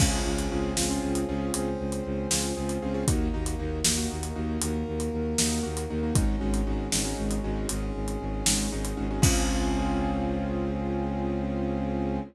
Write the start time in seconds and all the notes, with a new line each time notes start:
0.00 C#2 C4 C#4 F4 G#4, kick, crash
0.25 C#2 C4 C#4 F4 G#4
0.38 closed hi-hat
0.51 C#2 C4 C#4 F4 G#4
0.77 C#2 C4 C#4 F4 G#4, snare
0.90 C4 C#4 F4 G#4
1.03 C#2
1.15 closed hi-hat
1.28 C#2 C4 C#4 F4 G#4
1.54 C#2 C4 C#4 G#4 C5, closed hi-hat
1.79 C#2
1.92 closed hi-hat
2.05 C#2
2.31 C#2 C4 C#4 F4 G#4, snare
2.56 C#2 C4 C#4 F4 G#4
2.69 closed hi-hat
2.82 C#2 C4 C#4 F4 G#4
2.94 C4 C#4 F4 G#4
3.07 D#2 A#3 D#4 F#4, kick, closed hi-hat
3.33 D#2 A#3 D#4 F#4
3.46 closed hi-hat
3.59 D#2 A#3 D#4 F#4
3.85 D#2 A#3 D#4 F#4, snare
3.98 A#3 D#4 F#4
4.10 D#2
4.23 closed hi-hat
4.36 D#2 A#3 D#4 F#4
4.62 D#2 A#3 F#4 A#4, closed hi-hat
4.87 D#2
5.00 closed hi-hat
5.13 D#2
5.38 D#2 A#3 D#4 F#4, snare
5.63 D#2 A#3 D#4 F#4
5.77 closed hi-hat
5.90 D#2 A#3 D#4 F#4
6.03 A#3 D#4 F#4
6.15 G#1 G#3 C#4 D#4 F#4, kick, closed hi-hat
6.41 G#1 G#3 C#4 D#4 F#4
6.54 closed hi-hat
6.67 G#1 G#3 C#4 D#4 F#4
6.92 G#1 G#3 C#4 D#4 F#4, snare
7.05 G#3 C#4 D#4 F#4
7.18 G#1
7.31 closed hi-hat
7.44 G#1 G#3 C#4 D#4 F#4
7.69 G#1 G#3 C#4 F#4 G#4, closed hi-hat
7.95 G#1
8.08 closed hi-hat
8.21 G#1
8.46 G#1 G#3 C#4 D#4 F#4, snare
8.72 G#1 G#3 C#4 D#4 F#4
8.85 closed hi-hat
8.97 G#1 G#3 C#4 D#4 F#4
9.10 G#3 C#4 D#4 F#4
9.22 C#2 C4 C#4 F4 G#4, kick, crash